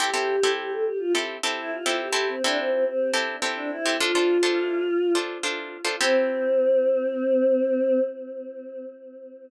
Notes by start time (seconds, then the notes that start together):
0.00 C4 E4 G4 A4
0.14 C4 E4 G4 A4
0.43 C4 E4 G4 A4
0.58 G4
0.70 A4
0.85 G4
0.99 F4
1.15 C4 E4 G4 A4
1.43 C4 E4 G4 A4
1.58 E4
1.71 F4
1.86 C4 E4 G4 A4
2.00 G4
2.13 C4 E4 G4 A4
2.28 C4
2.43 C4 D4 E4 G4 A4
2.57 C4
2.71 C4
2.85 C4
3.13 C4 E4 G4 A4
3.42 C4 E4 G4 A4
3.56 D4
3.71 E4
3.86 C4 E4 G4 A4
4.00 D4 F4 A4 C5
4.15 D4 F4 A4 C5
4.43 D4 F4 A4 C5
5.15 D4 F4 A4 C5
5.43 D4 F4 A4 C5
5.85 D4 F4 A4 C5
6.01 C4 E4 G4 A4